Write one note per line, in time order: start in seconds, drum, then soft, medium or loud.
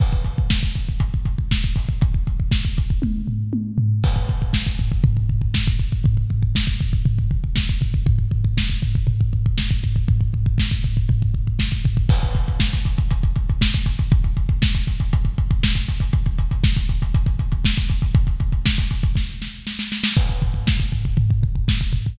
0.00 kick medium
0.00 crash medium
0.13 kick medium
0.24 kick medium
0.24 closed hi-hat medium
0.38 kick medium
0.50 kick medium
0.50 snare loud
0.63 kick medium
0.76 kick medium
0.76 closed hi-hat soft
0.89 kick medium
1.00 kick medium
1.00 closed hi-hat loud
1.14 kick medium
1.25 kick medium
1.25 closed hi-hat medium
1.38 kick medium
1.51 kick medium
1.51 snare medium
1.64 kick medium
1.76 kick medium
1.76 open hi-hat medium
1.89 kick medium
2.01 kick medium
2.01 closed hi-hat medium
2.14 kick medium
2.27 kick medium
2.27 closed hi-hat medium
2.40 kick medium
2.51 kick medium
2.51 snare medium
2.65 kick medium
2.77 kick medium
2.77 closed hi-hat medium
2.90 kick medium
3.02 kick medium
3.02 high tom medium
3.28 floor tom medium
3.53 high tom medium
3.78 floor tom medium
4.04 kick medium
4.04 crash loud
4.16 kick medium
4.28 kick medium
4.28 floor tom medium
4.42 kick medium
4.53 kick medium
4.53 snare loud
4.66 kick medium
4.79 kick medium
4.79 floor tom medium
4.92 kick medium
5.04 kick medium
5.04 floor tom loud
5.17 kick medium
5.29 kick medium
5.29 floor tom medium
5.41 kick medium
5.54 kick medium
5.54 snare loud
5.67 kick medium
5.80 kick medium
5.80 floor tom medium
5.92 kick medium
6.04 kick medium
6.04 floor tom medium
6.17 kick medium
6.30 kick medium
6.30 floor tom medium
6.43 kick medium
6.55 kick medium
6.55 snare loud
6.67 kick medium
6.80 kick medium
6.80 floor tom medium
6.93 kick medium
7.05 kick medium
7.05 floor tom loud
7.18 kick medium
7.31 kick medium
7.31 floor tom medium
7.44 kick medium
7.56 kick medium
7.56 snare medium
7.69 kick medium
7.81 kick medium
7.81 floor tom medium
7.94 kick medium
8.06 kick loud
8.06 floor tom medium
8.18 kick medium
8.31 kick medium
8.31 floor tom medium
8.45 kick medium
8.57 kick medium
8.57 snare loud
8.70 kick medium
8.82 kick medium
8.82 floor tom medium
8.95 kick medium
9.07 kick medium
9.07 floor tom medium
9.21 kick medium
9.33 kick medium
9.33 floor tom medium
9.46 kick medium
9.58 kick medium
9.58 snare medium
9.71 kick medium
9.83 kick medium
9.83 floor tom medium
9.96 kick medium
10.08 kick medium
10.08 floor tom medium
10.21 kick medium
10.33 kick medium
10.33 floor tom medium
10.46 kick medium
10.58 kick medium
10.58 snare loud
10.71 kick medium
10.84 kick medium
10.84 floor tom medium
10.97 kick medium
11.09 kick medium
11.09 floor tom medium
11.22 kick medium
11.34 kick medium
11.34 floor tom medium
11.47 kick medium
11.59 kick medium
11.59 snare medium
11.72 kick medium
11.85 kick medium
11.85 floor tom medium
11.97 kick medium
12.09 kick loud
12.09 crash loud
12.22 kick medium
12.22 closed hi-hat medium
12.35 kick medium
12.35 closed hi-hat medium
12.48 kick medium
12.48 closed hi-hat medium
12.60 kick medium
12.60 snare loud
12.73 kick medium
12.73 closed hi-hat medium
12.85 kick medium
12.85 closed hi-hat medium
12.98 kick medium
12.98 closed hi-hat medium
13.11 kick medium
13.11 closed hi-hat loud
13.23 kick medium
13.23 closed hi-hat medium
13.36 kick medium
13.36 closed hi-hat medium
13.49 kick medium
13.49 closed hi-hat medium
13.61 kick medium
13.61 snare loud
13.74 kick medium
13.74 closed hi-hat medium
13.86 kick medium
13.86 closed hi-hat medium
13.99 kick medium
13.99 closed hi-hat medium
14.12 kick loud
14.12 closed hi-hat medium
14.24 kick medium
14.24 closed hi-hat medium
14.37 kick medium
14.37 closed hi-hat medium
14.49 kick medium
14.49 closed hi-hat medium
14.62 kick medium
14.62 snare loud
14.75 kick medium
14.75 closed hi-hat medium
14.87 kick medium
14.87 closed hi-hat medium
15.00 kick medium
15.00 closed hi-hat medium
15.13 kick medium
15.13 closed hi-hat loud
15.25 kick medium
15.25 closed hi-hat medium
15.38 kick medium
15.38 closed hi-hat medium
15.51 kick medium
15.51 closed hi-hat medium
15.63 kick medium
15.63 snare loud
15.75 kick medium
15.75 closed hi-hat medium
15.88 kick medium
15.88 closed hi-hat medium
16.00 kick medium
16.00 closed hi-hat medium
16.13 kick medium
16.13 closed hi-hat medium
16.26 kick medium
16.26 closed hi-hat medium
16.38 kick medium
16.38 closed hi-hat medium
16.51 kick medium
16.51 closed hi-hat medium
16.64 kick loud
16.64 snare loud
16.77 kick medium
16.77 closed hi-hat medium
16.89 kick medium
16.89 closed hi-hat medium
17.02 kick medium
17.02 closed hi-hat medium
17.14 kick medium
17.14 closed hi-hat loud
17.26 kick medium
17.26 closed hi-hat medium
17.39 kick medium
17.39 closed hi-hat medium
17.52 kick medium
17.52 closed hi-hat medium
17.64 kick medium
17.64 snare loud
17.77 kick medium
17.77 closed hi-hat medium
17.89 kick medium
17.89 closed hi-hat medium
18.02 kick medium
18.02 closed hi-hat medium
18.15 kick loud
18.15 closed hi-hat loud
18.27 kick medium
18.27 closed hi-hat medium
18.40 kick medium
18.40 closed hi-hat medium
18.52 kick medium
18.52 closed hi-hat medium
18.66 kick medium
18.66 snare loud
18.78 kick medium
18.78 closed hi-hat medium
18.91 kick medium
18.91 closed hi-hat medium
19.03 kick medium
19.03 closed hi-hat medium
19.15 kick medium
19.15 snare medium
19.42 snare medium
19.67 snare medium
19.79 snare medium
19.92 snare medium
20.04 snare loud
20.17 kick loud
20.17 crash medium
20.29 kick medium
20.42 kick medium
20.42 floor tom medium
20.54 kick medium
20.67 kick medium
20.67 snare loud
20.80 kick medium
20.92 kick medium
20.92 floor tom medium
21.05 kick medium
21.17 kick medium
21.17 floor tom medium
21.30 kick medium
21.42 kick medium
21.42 floor tom medium
21.55 kick medium
21.68 kick medium
21.68 snare loud
21.81 kick medium
21.93 kick medium
21.93 floor tom medium
22.06 kick medium